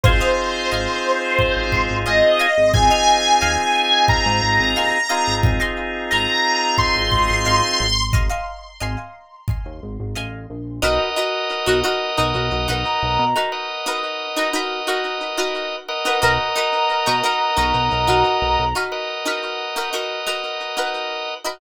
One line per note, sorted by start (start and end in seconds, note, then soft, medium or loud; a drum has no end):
0.04 0.20 G#1 medium
0.04 2.46 C4 medium
0.04 2.46 D#4 medium
0.04 2.46 F4 medium
0.04 2.46 G#4 medium
0.04 1.96 C5 medium
0.04 0.17 D#5 medium
0.04 0.17 F5 medium
0.04 0.17 G#5 medium
0.04 0.17 C6 medium
0.04 kick medium
0.21 0.61 D#5 medium
0.21 0.61 F5 medium
0.21 0.61 G#5 medium
0.21 0.61 C6 medium
0.71 0.88 G#1 medium
0.71 1.25 D#5 medium
0.71 1.25 F5 medium
0.71 1.25 G#5 medium
0.71 1.25 C6 medium
1.39 kick medium
1.57 1.72 G#1 medium
1.72 1.89 G#1 medium
1.72 kick medium
1.90 2.05 G#1 medium
2.06 2.22 G#1 medium
2.06 2.38 D#5 medium
2.06 2.72 D#5 soft
2.06 2.38 F5 medium
2.06 2.38 G#5 medium
2.06 2.38 C6 medium
2.39 2.87 D#5 medium
2.39 2.87 F5 medium
2.39 2.87 G#5 medium
2.39 2.87 C6 medium
2.58 2.73 G#1 medium
2.74 2.90 G#1 medium
2.74 4.98 C4 medium
2.74 4.98 D#4 medium
2.74 4.98 F4 medium
2.74 4.98 G#4 medium
2.74 4.08 G#5 medium
2.74 kick medium
2.90 3.31 D#5 medium
2.90 3.31 F5 medium
2.90 3.31 G#5 medium
2.90 3.31 C6 medium
3.41 3.57 D#2 medium
3.41 3.95 D#5 medium
3.41 3.95 F5 medium
3.41 3.95 G#5 medium
3.41 3.95 C6 medium
4.08 5.35 A#5 medium
4.08 kick medium
4.26 4.41 G#2 medium
4.43 4.58 G#1 medium
4.60 4.75 G#1 medium
4.76 4.92 D#2 medium
4.76 5.08 D#5 medium
4.76 5.08 F5 medium
4.76 5.08 G#5 medium
4.76 5.08 C6 medium
5.09 7.86 C4 medium
5.09 7.86 D#4 medium
5.09 7.86 F4 medium
5.09 7.86 G#4 medium
5.09 5.56 D#5 medium
5.09 5.56 F5 medium
5.09 5.56 G#5 medium
5.09 5.56 C6 medium
5.27 5.42 G#1 medium
5.43 5.60 G#1 medium
5.43 kick medium
5.60 6.00 D#5 medium
5.60 6.00 F5 medium
5.60 6.00 G#5 medium
5.60 6.00 C6 medium
6.11 6.27 G#1 medium
6.11 6.65 D#5 medium
6.11 6.65 F5 medium
6.11 6.65 G#5 medium
6.11 6.77 A#5 soft
6.11 6.65 C6 medium
6.78 8.04 C6 soft
6.78 kick medium
6.96 7.11 G#1 medium
7.12 7.28 G#1 medium
7.12 kick medium
7.30 7.45 G#1 medium
7.45 7.62 G#1 medium
7.45 7.99 D#5 medium
7.45 7.99 F5 medium
7.45 7.99 G#5 medium
7.45 7.99 C6 medium
7.80 8.29 G#1 medium
8.13 8.27 D#5 medium
8.13 8.27 F5 loud
8.13 8.27 G#5 medium
8.13 8.27 C6 medium
8.13 kick medium
8.29 8.70 D#5 medium
8.29 8.70 F5 medium
8.29 8.70 G#5 medium
8.29 8.70 C6 medium
8.80 8.96 G#1 medium
8.80 9.34 D#5 medium
8.80 9.34 F5 medium
8.80 9.34 G#5 medium
8.80 9.34 C6 medium
9.48 kick medium
9.65 9.81 D#2 medium
9.83 9.98 G#1 medium
10.00 10.15 G#1 medium
10.15 10.47 A1 medium
10.15 10.69 D#5 medium
10.15 10.69 F5 medium
10.15 10.69 G#5 medium
10.15 10.69 C6 medium
10.50 10.80 A#1 medium
10.82 10.98 B1 loud
10.82 11.09 D#4 loud
10.82 11.09 F#4 medium
10.82 13.25 A#4 loud
10.82 11.09 A#4 loud
10.82 13.25 B4 medium
10.82 11.09 B4 medium
10.82 13.25 D#5 loud
10.82 13.25 F#5 medium
11.16 11.57 D#4 medium
11.16 11.57 F#4 medium
11.16 11.57 A#4 medium
11.16 11.57 B4 medium
11.66 11.83 B1 medium
11.66 11.80 D#4 medium
11.66 11.80 F#4 medium
11.66 11.80 A#4 medium
11.66 11.80 B4 medium
11.84 12.11 D#4 medium
11.84 12.11 F#4 medium
11.84 12.11 A#4 medium
11.84 12.11 B4 medium
12.17 12.33 B1 medium
12.17 12.58 D#4 medium
12.17 12.58 F#4 medium
12.17 12.58 A#4 medium
12.17 12.58 B4 medium
12.35 12.50 B1 medium
12.52 12.67 B1 medium
12.68 12.84 B1 medium
12.68 13.22 D#4 medium
12.68 13.22 F#4 medium
12.68 13.22 A#4 medium
12.68 13.22 B4 medium
12.84 13.48 A#5 medium
13.03 13.18 B1 medium
13.19 13.34 B2 medium
13.36 13.76 D#4 medium
13.36 13.76 F#4 medium
13.36 13.76 A#4 medium
13.36 13.76 B4 medium
13.52 15.76 A#4 medium
13.52 15.76 B4 medium
13.52 15.76 D#5 medium
13.52 15.76 F#5 medium
13.86 14.27 D#4 medium
13.86 14.27 F#4 medium
13.86 14.27 A#4 medium
13.86 14.27 B4 medium
14.36 14.50 D#4 medium
14.36 14.50 F#4 medium
14.36 14.50 A#4 medium
14.36 14.50 B4 medium
14.53 14.80 D#4 medium
14.53 14.80 F#4 medium
14.53 14.80 A#4 medium
14.53 14.80 B4 medium
14.87 15.28 D#4 medium
14.87 15.28 F#4 medium
14.87 15.28 A#4 medium
14.87 15.28 B4 medium
15.37 15.91 D#4 medium
15.37 15.91 F#4 medium
15.37 15.91 A#4 medium
15.37 15.91 B4 medium
15.88 18.65 A#4 loud
15.88 18.65 B4 medium
15.88 18.65 D#5 loud
15.88 18.65 F#5 medium
16.05 16.19 D#4 medium
16.05 16.19 F#4 medium
16.05 16.19 A#4 medium
16.05 16.19 B4 medium
16.22 16.38 B1 loud
16.22 16.49 D#4 medium
16.22 16.49 F#4 loud
16.22 16.49 A#4 loud
16.22 16.49 B4 medium
16.22 18.74 A#5 medium
16.56 16.96 D#4 medium
16.56 16.96 F#4 medium
16.56 16.96 A#4 medium
16.56 16.96 B4 medium
17.06 17.22 B2 medium
17.06 17.20 D#4 medium
17.06 17.20 F#4 medium
17.06 17.20 A#4 medium
17.06 17.20 B4 medium
17.24 17.51 D#4 medium
17.24 17.51 F#4 medium
17.24 17.51 A#4 medium
17.24 17.51 B4 medium
17.57 17.73 B1 medium
17.57 17.97 D#4 medium
17.57 17.97 F#4 medium
17.57 17.97 A#4 medium
17.57 17.97 B4 medium
17.74 17.89 B1 medium
17.92 18.07 B1 medium
18.07 18.24 B1 medium
18.07 18.61 D#4 medium
18.07 18.61 F#4 medium
18.07 18.61 A#4 medium
18.07 18.61 B4 medium
18.42 18.57 B1 medium
18.59 18.74 B1 medium
18.75 19.16 D#4 medium
18.75 19.16 F#4 medium
18.75 19.16 A#4 medium
18.75 19.16 B4 medium
18.92 21.34 A#4 medium
18.92 21.34 B4 medium
18.92 21.34 D#5 medium
18.92 21.34 F#5 medium
19.25 19.66 D#4 medium
19.25 19.66 F#4 medium
19.25 19.66 A#4 medium
19.25 19.66 B4 medium
19.76 19.89 D#4 medium
19.76 19.89 F#4 medium
19.76 19.89 A#4 medium
19.76 19.89 B4 medium
19.93 20.20 D#4 medium
19.93 20.20 F#4 medium
19.93 20.20 A#4 medium
19.93 20.20 B4 medium
20.27 20.67 D#4 medium
20.27 20.67 F#4 medium
20.27 20.67 A#4 medium
20.27 20.67 B4 medium
20.77 21.31 D#4 medium
20.77 21.31 F#4 medium
20.77 21.31 A#4 medium
20.77 21.31 B4 medium
21.45 21.58 D#4 medium
21.45 21.58 F#4 medium
21.45 21.58 A#4 medium
21.45 21.58 B4 medium